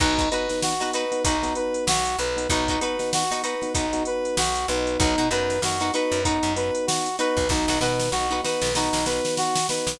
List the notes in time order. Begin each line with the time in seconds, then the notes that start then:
0.00 B1 B3 D#4 F#4 B4, kick, crash
0.18 D#4 F#4 B4, kick, closed hi-hat
0.31 B3 D#4 F#4 B4, closed hi-hat
0.49 B3 D#4 F#4, snare, closed hi-hat
0.62 F#4, snare
0.80 B3 D#4 F#4 B4, closed hi-hat
0.93 D#4 F#4 B4, closed hi-hat
1.12 B3 D#4 F#4, closed hi-hat
1.24 B1 D#4 F#4 B4, kick, closed hi-hat
1.43 B3 D#4 F#4, snare, closed hi-hat
1.55 B4, closed hi-hat
1.74 closed hi-hat
1.87 B1 F#4, snare
2.05 closed hi-hat
2.18 B1 B4, closed hi-hat
2.37 B3 D#4 F#4, closed hi-hat
2.49 B1 B3 D#4 F#4 B4, kick, closed hi-hat
2.68 D#4 F#4 B4, kick, closed hi-hat
2.81 B3 D#4 F#4 B4, closed hi-hat
2.99 B3 D#4 F#4, snare, closed hi-hat
3.13 F#4, snare
3.31 B3 D#4 F#4 B4, closed hi-hat
3.43 D#4 F#4 B4, closed hi-hat
3.61 B3 D#4 F#4, snare, closed hi-hat
3.74 B1 D#4 F#4 B4, kick, closed hi-hat
3.93 B3 D#4 F#4, closed hi-hat
4.05 B4, closed hi-hat
4.25 closed hi-hat
4.37 B1 F#4, snare
4.55 closed hi-hat
4.68 B1 B3 D#4 F#4 B4, closed hi-hat
4.87 closed hi-hat
4.99 B1 D#4 F#4 B4, kick, closed hi-hat
5.18 B2 D#4 F#4 B4, closed hi-hat
5.31 F#2 B3 D#4 F#4 B4, closed hi-hat
5.50 snare, closed hi-hat
5.62 F#2 B3 D#4 F#4, snare
5.80 B3 D#4 F#4 B4, closed hi-hat
5.94 B3 D#4 F#4 B4, closed hi-hat
6.12 F#2, closed hi-hat
6.24 B3 D#4 F#4 B4, kick, closed hi-hat
6.43 F#2, closed hi-hat
6.56 B3 D#4 F#4 B4, snare, closed hi-hat
6.75 closed hi-hat
6.87 F#4, snare
7.06 closed hi-hat
7.19 B3 D#4 F#4 B4, closed hi-hat
7.37 B1, kick, closed hi-hat
7.49 B1 B3 D#4 F#4, kick, snare
7.68 B1 D#4 F#4 B4, snare
7.81 B2 B3 D#4 F#4 B4, snare
8.00 snare
8.12 B1 B3 D#4 F#4, snare
8.31 B3 D#4 F#4 B4
8.43 B3 D#4 F#4 B4, snare
8.62 B1, snare
8.75 B3 D#4 F#4 B4, snare
8.93 B1, snare
9.06 B3 D#4 F#4 B4, snare
9.25 snare
9.37 F#4, snare
9.55 snare
9.69 B3 D#4 F#4 B4, snare
9.87 B1, snare